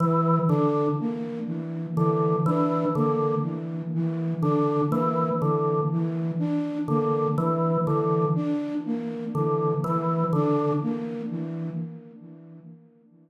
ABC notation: X:1
M:6/4
L:1/8
Q:1/4=61
K:none
V:1 name="Drawbar Organ" clef=bass
E, D, z2 D, E, D, z2 D, E, D, | z2 D, E, D, z2 D, E, D, z2 |]
V:2 name="Flute"
E, D ^A, E, E, D A, E, E, D A, E, | E, D ^A, E, E, D A, E, E, D A, E, |]